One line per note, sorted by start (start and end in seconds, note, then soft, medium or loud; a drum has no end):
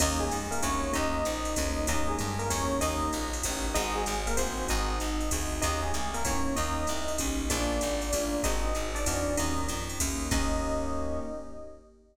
0.00 0.31 D#2 loud
0.00 0.25 A#3 loud
0.00 0.25 C#4 loud
0.00 0.25 D#4 medium
0.00 0.19 D#4 medium
0.00 0.25 G4 loud
0.00 0.19 D#5 medium
0.00 kick medium
0.00 crash loud
0.00 ride loud
0.20 0.43 G#3 medium
0.20 0.43 G#4 medium
0.31 0.61 F2 medium
0.31 hi-hat pedal medium
0.31 ride medium
0.51 0.60 A#3 medium
0.51 0.60 A#4 medium
0.51 ride medium
0.62 0.92 D2 medium
0.62 0.87 A#3 medium
0.62 0.87 C#4 medium
0.62 0.90 C#4 medium
0.62 0.87 D#4 medium
0.62 0.87 G4 medium
0.62 0.90 C#5 medium
0.62 kick medium
0.62 ride loud
0.93 1.24 D#2 loud
0.93 1.18 A#3 loud
0.93 1.18 C#4 loud
0.93 1.18 D#4 loud
0.93 1.83 D#4 medium
0.93 1.18 G4 loud
0.93 1.83 D#5 medium
0.93 kick medium
0.93 ride loud
1.25 1.55 A#1 medium
1.25 hi-hat pedal medium
1.25 ride medium
1.45 ride medium
1.56 1.87 D2 loud
1.56 1.81 A#3 medium
1.56 1.81 C#4 medium
1.56 1.81 D#4 medium
1.56 1.81 G4 medium
1.56 kick medium
1.56 ride loud
1.87 2.17 D#2 loud
1.87 2.12 A#3 loud
1.87 2.12 C#4 loud
1.87 2.12 D#4 loud
1.87 2.07 D#4 medium
1.87 2.12 G4 loud
1.87 2.07 D#5 loud
1.87 kick medium
1.87 ride loud
2.08 2.35 G#3 medium
2.08 2.35 G#4 medium
2.19 2.49 G2 medium
2.19 hi-hat pedal medium
2.19 ride loud
2.39 2.49 A#3 medium
2.39 2.49 A#4 medium
2.39 ride medium
2.50 2.80 E2 medium
2.50 2.74 A#3 medium
2.50 2.74 C#4 medium
2.50 2.79 C#4 medium
2.50 2.74 D#4 medium
2.50 2.74 G4 medium
2.50 2.79 C#5 medium
2.50 kick medium
2.50 ride loud
2.81 3.11 D#2 loud
2.81 3.07 A#3 loud
2.81 3.07 C#4 loud
2.81 3.25 D#4 medium
2.81 3.07 D#4 medium
2.81 3.07 G4 loud
2.81 3.25 D#5 medium
2.81 kick medium
2.81 ride loud
3.13 3.43 A#1 medium
3.13 hi-hat pedal medium
3.13 ride medium
3.33 ride medium
3.43 3.74 A1 medium
3.43 3.68 A#3 medium
3.43 3.68 C#4 medium
3.43 3.68 D#4 medium
3.43 3.68 G4 medium
3.43 kick medium
3.43 ride loud
3.74 4.05 G#1 loud
3.74 4.00 C4 loud
3.74 3.91 D#4 medium
3.74 4.00 D#4 loud
3.74 4.00 F#4 loud
3.74 4.00 G#4 loud
3.74 3.91 D#5 medium
3.74 kick medium
3.74 ride loud
3.95 4.21 G#3 medium
3.95 4.21 G#4 medium
4.06 4.36 G#1 medium
4.06 hi-hat pedal medium
4.06 ride medium
4.27 4.37 A#3 medium
4.27 4.37 A#4 medium
4.27 ride medium
4.37 4.67 A1 medium
4.37 4.65 C4 medium
4.37 4.63 C4 medium
4.37 4.63 D#4 loud
4.37 4.63 F#4 medium
4.37 4.63 G#4 medium
4.37 4.65 C5 medium
4.37 kick medium
4.37 ride loud
4.68 4.99 G#1 loud
4.68 4.93 C4 loud
4.68 4.93 D#4 loud
4.68 5.49 D#4 medium
4.68 4.93 F#4 loud
4.68 4.93 G#4 medium
4.68 5.49 D#5 medium
4.68 kick medium
4.68 ride medium
5.00 5.30 G#1 medium
5.00 hi-hat pedal medium
5.00 ride medium
5.21 ride medium
5.31 5.61 D2 medium
5.31 5.57 C4 medium
5.31 5.57 D#4 medium
5.31 5.57 F#4 medium
5.31 5.57 G#4 medium
5.31 kick medium
5.31 ride loud
5.62 5.92 D#2 loud
5.62 5.87 A#3 medium
5.62 5.87 C#4 medium
5.62 5.78 D#4 medium
5.62 5.87 D#4 medium
5.62 5.87 G4 loud
5.62 5.78 D#5 medium
5.62 kick medium
5.62 ride loud
5.83 6.07 G#3 medium
5.83 6.07 G#4 medium
5.94 6.23 C2 medium
5.94 hi-hat pedal medium
5.94 ride medium
6.14 6.23 A#3 medium
6.14 6.23 A#4 medium
6.14 ride medium
6.25 6.55 E2 medium
6.25 6.50 A#3 medium
6.25 6.54 C#4 medium
6.25 6.50 C#4 medium
6.25 6.50 D#4 medium
6.25 6.50 G4 medium
6.25 6.54 C#5 medium
6.25 kick medium
6.25 ride loud
6.56 6.87 D#2 loud
6.56 6.81 A#3 medium
6.56 6.81 C#4 loud
6.56 6.81 D#4 loud
6.56 7.11 D#4 medium
6.56 6.81 G4 loud
6.56 7.11 D#5 medium
6.56 kick medium
6.56 ride loud
6.87 7.18 C2 medium
6.87 hi-hat pedal medium
6.87 ride medium
7.08 ride medium
7.18 7.49 B1 medium
7.18 7.44 A#3 medium
7.18 7.44 C#4 loud
7.18 7.44 D#4 medium
7.18 7.44 G4 medium
7.18 kick medium
7.18 ride loud
7.50 7.80 A#1 loud
7.50 7.75 A#3 loud
7.50 7.75 D4 medium
7.50 8.35 D4 medium
7.50 7.75 F4 loud
7.50 7.75 G#4 loud
7.50 8.35 D5 medium
7.50 kick medium
7.50 ride loud
7.81 8.12 G#1 loud
7.81 hi-hat pedal medium
7.81 ride medium
8.02 ride medium
8.13 8.42 A1 medium
8.13 8.38 A#3 medium
8.13 8.38 D4 medium
8.13 8.38 F4 medium
8.13 8.38 G#4 medium
8.13 kick medium
8.13 ride loud
8.43 8.74 G#1 loud
8.43 8.69 C4 loud
8.43 8.84 D#4 medium
8.43 8.69 D#4 loud
8.43 8.69 F#4 loud
8.43 8.69 G#4 loud
8.43 8.84 D#5 medium
8.43 kick medium
8.43 ride loud
8.75 9.05 G#1 medium
8.75 hi-hat pedal medium
8.75 ride medium
8.95 9.35 D4 medium
8.95 9.35 D5 medium
8.95 ride medium
9.06 9.36 E2 medium
9.06 9.31 C4 medium
9.06 9.31 D#4 medium
9.06 9.31 F#4 medium
9.06 9.31 G#4 medium
9.06 kick medium
9.06 ride loud
9.37 9.68 D#2 loud
9.37 9.62 A#3 loud
9.37 9.62 C#4 loud
9.37 9.62 D#4 loud
9.37 9.65 D#4 medium
9.37 9.62 G4 loud
9.37 9.65 D#5 medium
9.37 ride loud
9.58 kick medium
9.68 9.98 F2 medium
9.68 hi-hat pedal medium
9.68 ride loud
9.89 ride medium
10.00 10.30 D2 medium
10.00 10.26 A#3 medium
10.00 10.26 C#4 medium
10.00 10.26 D#4 medium
10.00 10.26 G4 medium
10.00 kick medium
10.00 ride loud
10.31 11.20 D#2 loud
10.31 11.19 A#3 loud
10.31 11.19 C#4 loud
10.31 11.19 D#4 medium
10.31 11.19 G4 loud
10.31 11.19 D#5 loud
10.31 kick loud
10.31 crash loud